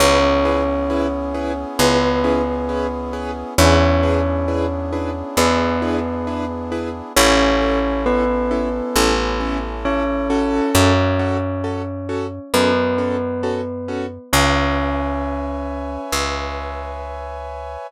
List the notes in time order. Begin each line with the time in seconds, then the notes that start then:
0.00 C#2 B3 C#4 E4 G#4 B4 C#5
0.45 C#4 E4 G#4 B4
0.90 C#4 E4 G#4 B4
1.35 C#4 E4 G#4 B4
1.79 C#2 B3 C#4 E4 G#4 B4
2.24 C#4 E4 G#4 B4
2.69 C#4 E4 G#4 B4
3.13 C#4 E4 G#4 B4
3.58 E2 B3 C#4 D4 E4 G#4 B4 C#5
4.03 D4 E4 G#4 B4
4.48 D4 E4 G#4 B4
4.93 D4 E4 G#4 B4
5.37 E2 B3 D4 E4 G#4 B4
5.82 D4 E4 G#4 B4
6.27 D4 E4 G#4 B4
6.72 D4 E4 G#4 B4
7.16 A1 C#4 E4 A4 C#5
7.61 C#4 E4 A4
8.06 B3 C#4 E4 A4 B4
8.51 C#4 E4 A4
8.96 A1 C#4 E4 A4
9.40 C#4 E4 A4
9.85 C#4 E4 A4 C#5
10.30 C#4 F#4 A4
10.75 F#2 C#4 C#5
11.19 C#4 F#4 A4
11.64 C#4 F#4 A4
12.09 C#4 F#4 A4
12.54 F#2 B3 C#4 F#4 A4 B4
12.98 C#4 F#4 A4
13.43 C#4 F#4 A4
13.88 C#4 F#4 A4
14.32 C#2 C#4 B4 C#5 E5 G#5
16.12 C#2